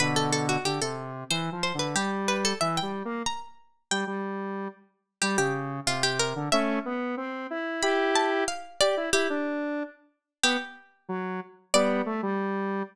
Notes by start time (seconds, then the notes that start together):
0.00 B2 D3 B4
0.16 A4
0.32 A4
0.49 F#4
0.65 D3 G4
0.81 C3 A4
1.30 E3 C5
1.52 F3
1.63 C5
1.74 D3
1.79 B4
1.95 G3 G4
2.28 B4
2.45 A4
2.61 E3 E5
2.77 G5
2.82 G3
3.05 A#3
3.26 A#5
3.91 G3 G5
4.07 G3
5.22 G3 G4
5.38 C#3 G4
5.86 C3 F4
6.03 G4
6.19 A#4
6.36 D3
6.52 A3 C#4 E5
6.85 B3
7.17 C4
7.50 E4
7.83 E4 G4 B5
8.15 A5
8.48 F5
8.81 G4 D5
8.97 E4
9.13 E4 G4
9.30 D4
10.43 B3 G4
11.09 F#3
11.74 G3 B3 D5
12.06 A3
12.23 G3